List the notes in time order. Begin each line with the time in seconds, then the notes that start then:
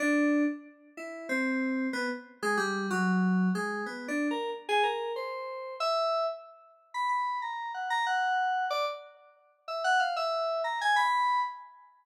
0.00 D4
0.97 E4
1.29 C4
1.93 B3
2.42 G#3
2.57 G3
2.90 F#3
3.55 G#3
3.86 B3
4.08 D4
4.31 A#4
4.69 G#4
4.83 A#4
5.16 C5
5.80 E5
6.94 B5
7.09 B5
7.42 A#5
7.74 F#5
7.90 A#5
8.06 F#5
8.70 D5
9.68 E5
9.84 F#5
10.00 F5
10.16 E5
10.64 A#5
10.81 G#5
10.96 B5